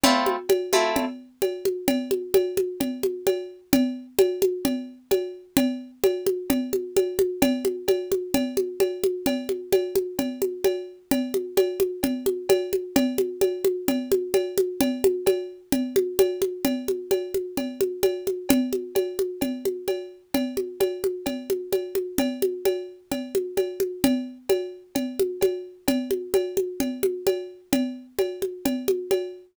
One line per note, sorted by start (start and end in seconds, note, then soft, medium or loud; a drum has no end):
0.04 0.36 A3 medium
0.04 0.36 C4 loud
0.04 0.36 E4 medium
0.04 0.36 F4 medium
0.04 cowbell loud
0.04 low conga loud
0.26 high conga medium
0.49 cowbell medium
0.49 high conga medium
0.73 1.05 A3 medium
0.73 1.05 C4 medium
0.73 1.05 E4 medium
0.73 1.05 F4 medium
0.73 high conga medium
0.96 cowbell medium
0.96 low conga medium
1.42 cowbell medium
1.42 high conga medium
1.65 high conga medium
1.88 cowbell medium
1.88 low conga medium
2.11 high conga medium
2.34 cowbell medium
2.34 high conga medium
2.57 high conga medium
2.80 cowbell medium
2.80 low conga medium
3.03 high conga medium
3.27 cowbell medium
3.27 high conga medium
3.73 cowbell medium
3.73 low conga loud
4.19 cowbell medium
4.19 high conga loud
4.42 high conga medium
4.65 cowbell medium
4.65 low conga medium
5.11 cowbell medium
5.11 high conga medium
5.57 cowbell medium
5.57 low conga loud
6.04 cowbell medium
6.04 high conga medium
6.27 high conga medium
6.50 cowbell medium
6.50 low conga loud
6.73 high conga medium
6.97 cowbell medium
6.97 high conga medium
7.19 high conga medium
7.42 cowbell loud
7.42 low conga loud
7.65 high conga medium
7.88 cowbell medium
7.88 high conga medium
8.12 high conga medium
8.34 cowbell medium
8.34 low conga medium
8.57 high conga medium
8.80 cowbell medium
8.80 high conga medium
9.04 high conga medium
9.26 cowbell medium
9.26 low conga medium
9.49 high conga medium
9.73 cowbell medium
9.73 high conga medium
9.96 high conga medium
10.19 cowbell medium
10.19 low conga medium
10.42 high conga medium
10.64 cowbell medium
10.64 high conga medium
11.11 cowbell medium
11.11 low conga medium
11.34 high conga medium
11.57 cowbell medium
11.57 high conga medium
11.80 high conga medium
12.03 cowbell medium
12.03 low conga medium
12.26 high conga medium
12.49 cowbell medium
12.49 high conga medium
12.73 high conga medium
12.96 cowbell loud
12.96 low conga loud
13.18 high conga medium
13.41 cowbell medium
13.41 high conga medium
13.65 high conga medium
13.88 cowbell medium
13.88 low conga medium
14.12 high conga medium
14.34 cowbell medium
14.34 high conga medium
14.58 high conga medium
14.81 cowbell medium
14.81 low conga loud
15.04 high conga medium
15.26 cowbell medium
15.26 high conga medium
15.72 cowbell medium
15.72 low conga medium
15.96 high conga medium
16.19 cowbell medium
16.19 high conga medium
16.42 high conga medium
16.65 cowbell medium
16.65 low conga medium
16.88 high conga medium
17.11 cowbell medium
17.11 high conga medium
17.34 high conga medium
17.57 cowbell medium
17.57 low conga medium
17.81 high conga medium
18.03 cowbell medium
18.03 high conga medium
18.27 high conga medium
18.49 cowbell medium
18.49 low conga loud
18.73 high conga medium
18.95 cowbell medium
18.95 high conga medium
19.19 high conga medium
19.41 cowbell medium
19.41 low conga medium
19.65 high conga medium
19.88 cowbell medium
19.88 high conga medium
20.34 cowbell medium
20.34 low conga medium
20.57 high conga medium
20.80 cowbell medium
20.80 high conga medium
21.04 high conga medium
21.26 cowbell medium
21.26 low conga medium
21.50 high conga medium
21.72 cowbell medium
21.72 high conga medium
21.95 high conga medium
22.18 cowbell medium
22.18 low conga medium
22.42 high conga medium
22.65 cowbell medium
22.65 high conga medium
23.12 cowbell medium
23.12 low conga medium
23.35 high conga medium
23.57 cowbell medium
23.57 high conga medium
23.80 high conga medium
24.04 cowbell medium
24.04 low conga loud
24.49 cowbell medium
24.49 high conga medium
24.95 cowbell medium
24.95 low conga medium
25.20 high conga medium
25.41 cowbell medium
25.41 high conga medium
25.88 cowbell medium
25.88 low conga loud
26.11 high conga medium
26.34 cowbell medium
26.34 high conga medium
26.57 high conga medium
26.80 cowbell medium
26.80 low conga medium
27.03 high conga medium
27.27 cowbell medium
27.27 high conga medium
27.73 cowbell medium
27.73 low conga loud
28.19 cowbell medium
28.19 high conga medium
28.42 high conga medium
28.65 cowbell medium
28.65 low conga medium
28.88 high conga medium
29.11 cowbell medium
29.11 high conga medium